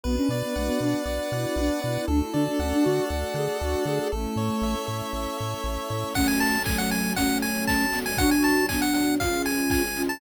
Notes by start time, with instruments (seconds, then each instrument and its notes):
0.03 synth bass 1 B1, ocarina B3, string ensemble 1 B3 D4 F#4, lead 1 (square) B4
0.17 ocarina C#4
0.29 synth bass 1 B2, ocarina B3, lead 1 (square) D5
0.42 ocarina B3
0.56 synth bass 1 B1, ocarina A3, lead 1 (square) F#5
0.67 ocarina B3
0.80 synth bass 1 B2, ocarina D4, lead 1 (square) B4
1.06 synth bass 1 B1, lead 1 (square) D5
1.32 synth bass 1 B2, ocarina E4, lead 1 (square) F#5
1.56 synth bass 1 B1, ocarina D4, lead 1 (square) B4
1.82 synth bass 1 B2, ocarina E4, lead 1 (square) D5
1.96 ocarina E4
2.07 synth bass 1 D2, string ensemble 1 A3 D4 F#4, ocarina D4, lead 1 (square) A4
2.22 ocarina E4
2.32 synth bass 1 D3, ocarina D4, lead 1 (square) D5
2.47 ocarina D4
2.59 synth bass 1 D2, ocarina C#4, lead 1 (square) F#5
2.72 ocarina D4
2.83 synth bass 1 D3, ocarina F#4, lead 1 (square) A4
3.10 synth bass 1 D2, lead 1 (square) D5
3.34 synth bass 1 D3, ocarina G#4, lead 1 (square) F#5
3.60 synth bass 1 D2, ocarina F#4, lead 1 (square) A4
3.85 synth bass 1 D3, ocarina G#4, lead 1 (square) D5
4.00 ocarina G#4
4.12 synth bass 1 A1, string ensemble 1 A3 C#4 E4, ocarina A3, lead 1 (square) A4
4.36 synth bass 1 A2, lead 1 (square) C#5
4.62 synth bass 1 A1, lead 1 (square) E5
4.86 synth bass 1 A2, lead 1 (square) A4
5.13 synth bass 1 A1, lead 1 (square) C#5
5.38 synth bass 1 A2, lead 1 (square) E5
5.64 synth bass 1 A1, lead 1 (square) A4
5.90 synth bass 1 A2, lead 1 (square) C#5
6.14 string ensemble 1 F#3 C#4 A4, ocarina A3 C#4, lead 1 (square) F#5, kick, crash
6.26 lead 1 (square) G#5, closed hi-hat
6.40 lead 1 (square) A5, open hi-hat
6.52 closed hi-hat
6.64 ocarina F#3 A3, lead 1 (square) G#5, kick, clap
6.78 lead 1 (square) F#5, closed hi-hat
6.91 lead 1 (square) G#5, open hi-hat
7.04 closed hi-hat
7.16 string ensemble 1 F#3 C#4 A4, ocarina A3 C#4, lead 1 (square) F#5, kick, closed hi-hat
7.29 closed hi-hat
7.42 lead 1 (square) G#5, open hi-hat
7.55 closed hi-hat
7.67 lead 1 (square) A5, kick, snare
7.80 closed hi-hat
7.93 ocarina G#3 B3, open hi-hat
8.06 lead 1 (square) G#5, open hi-hat
8.17 string ensemble 1 B2 F#3 D4, ocarina D4 F#4, lead 1 (square) F#5, kick, closed hi-hat
8.31 lead 1 (square) G#5, closed hi-hat
8.42 lead 1 (square) A5, open hi-hat
8.56 closed hi-hat
8.69 ocarina B3 D4, lead 1 (square) G#5, kick, clap
8.81 lead 1 (square) F#5, closed hi-hat
8.94 lead 1 (square) F#5, open hi-hat
9.07 closed hi-hat
9.20 string ensemble 1 C#3 F3 G#3, ocarina C#4 F4, lead 1 (square) F5, kick, closed hi-hat
9.33 closed hi-hat
9.45 lead 1 (square) G#5, open hi-hat
9.58 closed hi-hat
9.70 lead 1 (square) G#5, kick, clap
9.84 closed hi-hat
9.96 ocarina C#4 F4, open hi-hat
10.09 lead 1 (square) A5, closed hi-hat